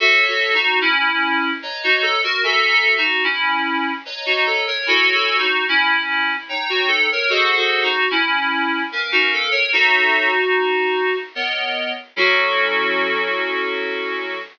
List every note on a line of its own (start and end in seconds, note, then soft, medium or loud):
0.00 0.24 F#4 medium
0.00 0.57 F#4 medium
0.00 0.24 A4 loud
0.00 0.57 C#5 medium
0.00 0.57 E5 medium
0.00 0.57 A5 medium
0.28 0.53 F#4 medium
0.28 0.54 A4 medium
0.54 0.80 D#4 medium
0.54 0.80 F#4 medium
0.81 1.50 C#4 medium
0.81 1.50 E4 medium
1.62 2.19 B4 medium
1.62 2.19 C#5 medium
1.62 2.19 D#5 medium
1.62 2.19 A#5 medium
1.84 2.03 D#4 medium
1.84 2.03 F#4 medium
2.02 2.21 A4 medium
2.24 2.43 F#4 medium
2.24 2.43 A#4 medium
2.43 3.00 F#4 medium
2.43 2.69 A4 medium
2.43 3.00 E5 medium
2.43 3.00 G#5 medium
2.43 3.00 A#5 medium
2.69 2.95 A4 medium
2.97 3.23 D#4 medium
2.97 3.23 F#4 medium
3.24 3.91 C#4 medium
3.24 3.91 E4 medium
4.05 4.62 B4 medium
4.05 4.62 C#5 medium
4.05 4.62 D#5 medium
4.05 4.62 A#5 medium
4.26 4.45 D#4 medium
4.26 4.45 F#4 medium
4.46 4.66 A4 medium
4.67 4.86 A#4 medium
4.67 4.86 C#5 medium
4.86 5.43 E4 medium
4.86 5.13 F#4 medium
4.86 5.13 A4 medium
4.86 5.43 C#5 medium
4.86 5.43 G#5 medium
4.86 5.43 B5 medium
5.14 5.38 F#4 medium
5.14 5.39 A4 medium
5.38 5.64 D#4 medium
5.38 5.64 F#4 medium
5.68 6.36 C#4 medium
5.68 6.36 E4 medium
6.49 7.05 D#4 medium
6.49 7.05 C#5 medium
6.49 7.05 G5 medium
6.49 7.05 A#5 medium
6.69 6.89 F#4 medium
6.88 7.07 A4 medium
7.11 7.31 A#4 medium
7.11 7.31 C#5 medium
7.29 7.55 F#4 medium
7.29 7.86 G#4 medium
7.29 7.55 A4 medium
7.29 7.86 C5 medium
7.29 7.86 D#5 medium
7.29 7.86 F#5 medium
7.56 7.82 F#4 medium
7.56 7.82 A4 medium
7.83 8.08 D#4 medium
7.83 8.08 F#4 medium
8.10 8.82 C#4 medium
8.10 8.82 E4 medium
8.92 9.49 C#4 medium
8.92 9.49 A#4 medium
8.92 9.49 B4 medium
8.92 9.49 F5 medium
9.12 9.31 D#4 medium
9.12 9.31 F#4 medium
9.33 9.52 A4 medium
9.51 9.70 A#4 medium
9.51 9.70 C#5 medium
9.72 11.15 D#4 medium
9.72 11.15 F#4 loud
9.72 10.30 A4 medium
9.72 10.30 C#5 medium
9.72 10.30 E5 medium
11.35 11.92 B3 medium
11.35 11.92 A#4 medium
11.35 11.92 C#5 medium
11.35 11.92 D#5 medium
12.16 14.37 F#3 loud
12.16 14.37 C#4 loud
12.16 14.37 E4 loud
12.16 14.38 F#4 loud
12.16 14.37 A4 loud